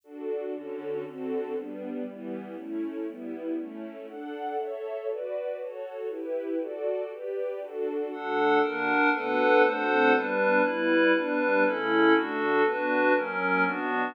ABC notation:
X:1
M:2/4
L:1/8
Q:1/4=119
K:D
V:1 name="String Ensemble 1"
[DFA]2 [D,CFA]2 | [D,=CFA]2 [G,B,D]2 | [E,G,B,]2 [A,CE]2 | [G,B,E]2 [A,CE]2 |
[DAf]2 [Ace]2 | [FBd]2 [FAc]2 | [EGB]2 [FAd]2 | [GBd]2 [DFA]2 |
[D,A,F]2 [D,^A,F]2 | [D,A,B,F]2 [D,A,=CF]2 | [G,B,D]2 [G,B,E]2 | [G,B,D]2 [C,A,E]2 |
[D,A,F]2 [D,B,F]2 | [F,^A,C]2 [B,,F,D]2 |]
V:2 name="Pad 5 (bowed)"
z4 | z4 | z4 | z4 |
z4 | z4 | z4 | z4 |
[DAf]2 [D^Af]2 | [DABf]2 [DA=cf]2 | [G,DB]2 [G,EB]2 | [G,DB]2 [CEA]2 |
[DFA]2 [DFB]2 | [F,C^A]2 [B,DF]2 |]